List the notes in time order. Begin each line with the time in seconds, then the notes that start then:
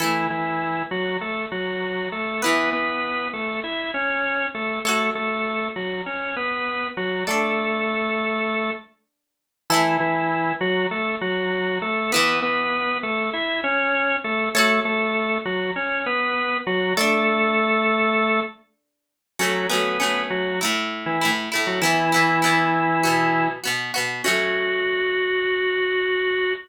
0.00 E3 A3 E4 A4
0.30 E3 E4
0.91 F#3 F#4
1.21 A3 A4
1.52 F#3 F#4
2.12 A3 A4
2.42 E3 B3 E4 B4
2.73 B3 B4
3.33 A3 A4
3.64 E4 E5
3.94 C#4 C#5
4.54 A3 A4
4.85 A3 F#4 A4 C#5
5.15 A3 A4
5.76 F#3 F#4
6.06 C#4 C#5
6.36 B3 B4
6.97 F#3 F#4
7.27 A3 D4 A4 D5
9.70 E3 A3 E4 A4
10.00 E3 E4
10.61 F#3 F#4
10.91 A3 A4
11.21 F#3 F#4
11.82 A3 A4
12.12 E3 B3 E4 B4
12.42 B3 B4
13.03 A3 A4
13.33 E4 E5
13.64 C#4 C#5
14.24 A3 A4
14.55 A3 F#4 A4 C#5
14.85 A3 A4
15.45 F#3 F#4
15.76 C#4 C#5
16.06 B3 B4
16.67 F#3 F#4
16.97 A3 D4 A4 D5
19.39 F#3 A3 C#4 F#4
19.69 F#3 A3 B3 C#4 B4
20.00 F#3 A3 C#4
20.30 F#3 F#4
20.61 A2 A3 E4
21.06 E3 E4
21.21 A2 A3 E4
21.52 A2 A3 E4
21.67 F#3 F#4
21.82 E3 B3 E4
22.12 E3 B3 E4
22.42 E3 B3 E4
23.03 B2 B3 F#4
23.64 B2 B3 F#4
23.94 B2 B3 F#4
24.24 F#3 A3 C#4 F#4